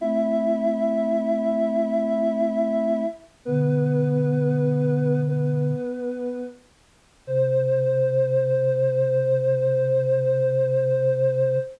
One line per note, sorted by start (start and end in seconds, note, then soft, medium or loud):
0.00 3.04 A3 medium
0.00 3.04 C4 medium
0.00 3.03 E4 medium
0.00 3.03 E5 loud
3.45 5.72 B2 medium
3.45 5.72 D3 medium
3.45 5.19 B3 medium
3.45 5.19 B4 loud
5.28 6.41 B3 medium
5.28 6.41 B4 medium
7.27 11.56 C3 loud
7.27 11.56 C5 loud